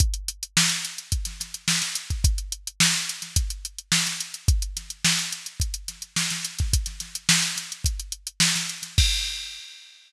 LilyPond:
\new DrumStaff \drummode { \time 4/4 \tempo 4 = 107 <hh bd>16 hh16 hh16 hh16 sn16 hh16 hh16 hh16 <hh bd>16 <hh sn>16 <hh sn>16 hh16 sn16 <hh sn>16 hh16 <hh bd>16 | <hh bd>16 hh16 hh16 hh16 sn16 <hh sn>16 hh16 <hh sn>16 <hh bd>16 hh16 hh16 hh16 sn16 <hh sn>16 hh16 hh16 | <hh bd>16 hh16 <hh sn>16 hh16 sn16 hh16 hh16 hh16 <hh bd>16 hh16 <hh sn>16 hh16 sn16 <hh sn>16 hh16 <hh bd sn>16 | <hh bd>16 <hh sn>16 <hh sn>16 hh16 sn16 hh16 <hh sn>16 hh16 <hh bd>16 hh16 hh16 hh16 sn16 <hh sn>16 hh16 <hh sn>16 |
<cymc bd>4 r4 r4 r4 | }